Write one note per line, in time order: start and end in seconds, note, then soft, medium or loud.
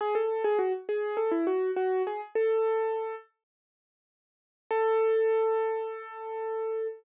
0.01 0.15 G#4 medium
0.15 0.43 A4 medium
0.44 0.58 G#4 medium
0.59 0.73 F#4 medium
0.89 1.18 G#4 medium
1.17 1.31 A4 medium
1.31 1.45 E4 medium
1.47 1.71 F#4 medium
1.76 2.02 F#4 medium
2.07 2.21 G#4 medium
2.35 3.15 A4 medium
4.71 6.87 A4 loud